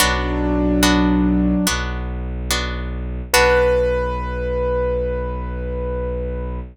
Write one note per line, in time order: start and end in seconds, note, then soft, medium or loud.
0.00 1.54 B1 loud
0.00 1.66 F#3 medium
0.00 0.74 B3 medium
0.00 0.74 D4 loud
0.00 1.66 D4 medium
0.00 0.74 F#4 loud
0.83 1.58 B3 medium
0.83 1.58 D4 medium
0.83 1.58 F#4 medium
1.67 3.21 B1 loud
1.67 2.42 B3 medium
1.67 2.42 D4 medium
1.67 2.42 F#4 loud
2.51 3.26 B3 medium
2.51 3.26 D4 medium
2.51 3.26 F#4 medium
3.33 6.60 B1 loud
3.33 6.60 B3 loud
3.33 6.60 D4 loud
3.33 6.60 F#4 loud
3.33 6.60 B4 loud